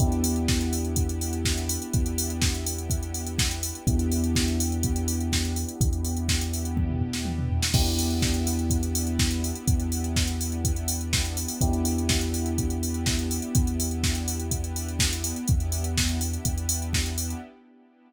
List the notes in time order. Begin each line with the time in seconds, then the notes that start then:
0.00 E2 B3 D4 E4 G4, kick, closed hi-hat
0.12 closed hi-hat
0.24 open hi-hat
0.36 closed hi-hat
0.48 kick, snare
0.61 closed hi-hat
0.73 open hi-hat
0.85 closed hi-hat
0.96 kick, closed hi-hat
1.09 closed hi-hat
1.21 open hi-hat
1.33 closed hi-hat
1.45 kick, snare
1.58 closed hi-hat
1.69 open hi-hat
1.82 closed hi-hat
1.93 E2, kick, closed hi-hat
2.06 closed hi-hat
2.18 open hi-hat
2.30 closed hi-hat
2.42 kick, snare
2.54 closed hi-hat
2.66 open hi-hat
2.78 closed hi-hat
2.90 kick, closed hi-hat
3.03 closed hi-hat
3.14 open hi-hat
3.27 closed hi-hat
3.39 kick, snare
3.51 closed hi-hat
3.63 open hi-hat
3.75 closed hi-hat
3.87 E2 B3 D4 E4 G4, kick, closed hi-hat
3.99 closed hi-hat
4.12 open hi-hat
4.24 closed hi-hat
4.35 kick, snare
4.48 closed hi-hat
4.60 open hi-hat
4.72 closed hi-hat
4.83 kick, closed hi-hat
4.96 closed hi-hat
5.08 open hi-hat
5.20 closed hi-hat
5.32 kick, snare
5.45 closed hi-hat
5.56 open hi-hat
5.69 closed hi-hat
5.80 E2, kick, closed hi-hat
5.93 closed hi-hat
6.05 open hi-hat
6.17 closed hi-hat
6.29 kick, snare
6.41 closed hi-hat
6.54 open hi-hat
6.65 closed hi-hat
6.77 kick, high tom
6.89 mid tom
7.01 floor tom
7.13 snare
7.25 high tom
7.39 mid tom
7.50 floor tom
7.63 snare
7.74 E2 B3 D4 E4 G4, kick, crash
7.86 closed hi-hat
7.99 open hi-hat
8.10 closed hi-hat
8.22 kick, snare
8.34 closed hi-hat
8.47 open hi-hat
8.59 closed hi-hat
8.70 kick, closed hi-hat
8.83 closed hi-hat
8.95 open hi-hat
9.07 closed hi-hat
9.19 kick, snare
9.31 closed hi-hat
9.44 open hi-hat
9.55 closed hi-hat
9.68 E2, kick, closed hi-hat
9.80 closed hi-hat
9.92 open hi-hat
10.04 closed hi-hat
10.16 kick, snare
10.27 closed hi-hat
10.41 open hi-hat
10.52 closed hi-hat
10.65 kick, closed hi-hat
10.76 closed hi-hat
10.88 open hi-hat
11.01 closed hi-hat
11.13 kick, snare
11.25 closed hi-hat
11.37 open hi-hat
11.48 open hi-hat
11.61 E2 B3 D4 E4 G4, kick, closed hi-hat
11.73 closed hi-hat
11.85 open hi-hat
11.98 closed hi-hat
12.09 kick, snare
12.21 closed hi-hat
12.34 open hi-hat
12.46 closed hi-hat
12.58 kick, closed hi-hat
12.70 closed hi-hat
12.83 open hi-hat
12.94 closed hi-hat
13.06 kick, snare
13.19 closed hi-hat
13.31 open hi-hat
13.42 closed hi-hat
13.55 E2, kick, closed hi-hat
13.67 closed hi-hat
13.80 open hi-hat
13.91 closed hi-hat
14.03 kick, snare
14.15 closed hi-hat
14.28 open hi-hat
14.40 closed hi-hat
14.51 kick, closed hi-hat
14.64 closed hi-hat
14.76 open hi-hat
14.89 closed hi-hat
14.99 kick, snare
15.13 closed hi-hat
15.24 open hi-hat
15.36 closed hi-hat
15.48 E2 B3 D4 E4 G4, kick, closed hi-hat
15.60 closed hi-hat
15.72 open hi-hat
15.84 closed hi-hat
15.97 kick, snare
16.09 closed hi-hat
16.21 open hi-hat
16.33 closed hi-hat
16.45 E2, kick, closed hi-hat
16.58 closed hi-hat
16.69 open hi-hat
16.82 closed hi-hat
16.93 kick, snare
17.06 closed hi-hat
17.18 open hi-hat
17.30 closed hi-hat